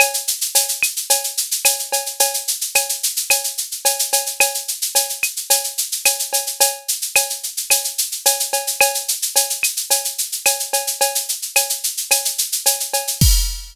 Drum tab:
CC |----------------|----------------|----------------|----------------|
SH |xxxxxxxxxxxxxxxx|xxxxxxxxxxxxxxxx|xxxxxxxxxxxxxxxx|x-xxxxxxxxxxxxxx|
CB |x---x---x---x-x-|x---x---x---x-x-|x---x---x---x-x-|x---x---x---x-x-|
CL |x-----x-----x---|----x---x-------|x-----x-----x---|----x---x-------|
BD |----------------|----------------|----------------|----------------|

CC |----------------|----------------|x---------------|
SH |xxxxxxxxxxxxxxxx|xxxxxxxxxxxxxxxx|----------------|
CB |x---x---x---x-x-|x---x---x---x-x-|----------------|
CL |x-----x-----x---|----x---x-------|----------------|
BD |----------------|----------------|o---------------|